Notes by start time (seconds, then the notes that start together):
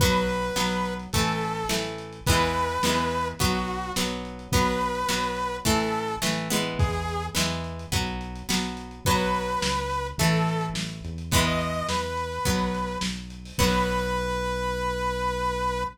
0.00 B1 F#3 B3 B4, kick, closed hi-hat
0.14 closed hi-hat
0.29 closed hi-hat
0.42 closed hi-hat
0.56 B1 F#3 B3, snare
0.70 closed hi-hat
0.85 closed hi-hat
0.99 closed hi-hat
1.13 A1 E3 A3 A4, kick, closed hi-hat
1.27 closed hi-hat
1.41 closed hi-hat
1.55 closed hi-hat
1.69 A1 E3 A3, snare
1.85 closed hi-hat
1.98 closed hi-hat
2.13 closed hi-hat
2.26 E2 E3 G#3 B3 B4, kick, closed hi-hat
2.42 closed hi-hat
2.54 closed hi-hat
2.69 closed hi-hat
2.83 E2 E3 G#3 B3, snare
2.98 closed hi-hat
3.11 closed hi-hat
3.25 closed hi-hat
3.39 B1 F#3 B3 F#4, kick, closed hi-hat
3.55 closed hi-hat
3.68 closed hi-hat
3.82 closed hi-hat
3.96 B1 F#3 B3, snare
4.11 closed hi-hat
4.25 closed hi-hat
4.39 closed hi-hat
4.52 B1 F#3 B3 B4, kick, closed hi-hat
4.67 closed hi-hat
4.81 closed hi-hat
4.95 closed hi-hat
5.09 B1 F#3 B3, snare
5.24 closed hi-hat
5.37 closed hi-hat
5.52 closed hi-hat
5.65 A1 E3 A3 A4, kick, closed hi-hat
5.80 closed hi-hat
5.95 closed hi-hat
6.08 closed hi-hat
6.22 A1 E3 A3, snare
6.37 closed hi-hat
6.50 E3 G#3 B3, closed hi-hat
6.65 closed hi-hat
6.79 E2 G#4, kick, closed hi-hat
6.93 closed hi-hat
7.08 closed hi-hat
7.23 closed hi-hat
7.35 E2 E3 G#3 B3, snare
7.50 closed hi-hat
7.64 closed hi-hat
7.79 closed hi-hat
7.92 B1 F#3 B3, kick, closed hi-hat
8.07 closed hi-hat
8.21 closed hi-hat
8.35 closed hi-hat
8.49 B1 F#3 B3, snare
8.63 closed hi-hat
8.77 closed hi-hat
8.91 closed hi-hat
9.05 B1 F#3 B3 B4, kick, closed hi-hat
9.19 closed hi-hat
9.35 closed hi-hat
9.49 closed hi-hat
9.62 C#2, snare
9.77 closed hi-hat
9.90 closed hi-hat
10.05 closed hi-hat
10.18 A1 E3 A3 A4, kick, closed hi-hat
10.33 closed hi-hat
10.48 closed hi-hat
10.61 closed hi-hat
10.74 A1, snare
10.89 closed hi-hat
11.04 E2, closed hi-hat
11.18 closed hi-hat
11.31 E3 G#3 B3 B4, kick, closed hi-hat
11.45 D#5, closed hi-hat
11.61 closed hi-hat
11.73 closed hi-hat
11.88 E2 B4, snare
12.02 closed hi-hat
12.17 closed hi-hat
12.32 closed hi-hat
12.45 B1 F#3 B3, kick, closed hi-hat
12.60 closed hi-hat
12.75 closed hi-hat
12.88 closed hi-hat
13.01 B1, snare
13.15 closed hi-hat
13.30 closed hi-hat
13.45 open hi-hat
13.58 B1 F#3 B3 B4, kick, crash